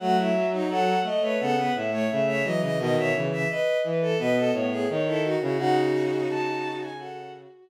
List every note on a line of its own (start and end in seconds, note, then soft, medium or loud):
0.00 0.95 F#3 medium
0.00 0.29 A3 medium
0.00 0.17 F#4 medium
0.00 0.16 F#5 loud
0.17 0.34 E4 medium
0.17 0.47 E5 medium
0.34 0.65 F#3 medium
0.52 0.69 D#4 medium
0.69 0.99 F#3 medium
0.69 0.98 A4 medium
0.69 1.00 F#5 medium
1.03 1.19 A3 medium
1.03 1.22 A3 medium
1.03 1.22 D#5 loud
1.21 1.38 A3 medium
1.21 1.39 B4 medium
1.21 1.37 C#5 medium
1.39 1.68 C#3 medium
1.39 1.55 B3 medium
1.39 1.56 A4 medium
1.39 1.71 F#5 medium
1.55 1.72 B3 medium
1.55 1.74 B4 medium
1.75 2.09 A2 medium
1.75 1.91 E5 medium
1.91 2.07 A3 medium
1.91 2.09 C#5 medium
2.09 2.43 C#3 medium
2.09 2.40 A3 medium
2.09 2.25 E5 medium
2.26 2.43 C#5 medium
2.26 2.43 E5 medium
2.43 2.61 E3 medium
2.43 2.60 F#3 medium
2.43 2.61 D#5 medium
2.61 2.77 C#3 medium
2.61 2.78 E3 medium
2.61 2.78 D#5 medium
2.78 2.95 B2 medium
2.78 3.10 D#3 medium
2.78 2.95 D#5 medium
2.78 2.96 D#5 medium
2.96 3.12 B2 medium
2.96 3.27 C#5 medium
2.96 3.13 E5 medium
3.14 3.45 C#3 medium
3.14 3.48 E3 medium
3.31 3.48 E5 medium
3.49 3.77 B4 medium
3.49 3.81 D#5 medium
3.83 4.14 E3 medium
3.83 4.00 B4 medium
4.01 4.18 A4 medium
4.18 4.48 B2 medium
4.18 4.51 B3 medium
4.18 4.35 B4 medium
4.18 4.51 D#5 medium
4.36 4.53 A4 medium
4.53 4.87 A2 medium
4.53 4.85 B3 medium
4.53 4.70 C#5 medium
4.71 4.87 G#4 medium
4.89 5.36 D#3 medium
4.89 5.33 D#4 medium
4.89 5.06 C#5 medium
5.06 5.22 E4 medium
5.06 5.23 A4 medium
5.23 5.40 F#4 medium
5.41 5.58 C#3 medium
5.41 5.59 E4 medium
5.41 5.57 F#4 medium
5.57 6.26 C#3 medium
5.57 6.89 D#4 medium
5.57 6.47 F#4 medium
5.57 6.89 F#4 loud
5.57 5.75 F#5 loud
6.29 7.45 C#3 medium
6.29 6.74 A5 medium
6.63 6.80 F#4 medium
6.81 6.97 G#5 medium
6.97 7.69 F#4 medium
6.97 7.31 A4 medium
6.97 7.31 F#5 medium